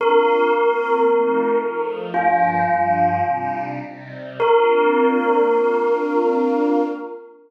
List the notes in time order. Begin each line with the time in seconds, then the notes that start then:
0.00 A#3 C4 D4 F4 A#4
0.51 A#3 C4 F4 A#4
1.06 F3 A3 C4 D#4
1.60 F3 A3 D#4 F4
2.13 G2 F3 A#3 D4 F4
2.66 G2 F3 G3 D4
3.22 C3 G3 D4 D#4
3.79 C3 G3 C4 D#4
4.40 A#3 C4 D4 F4 A#4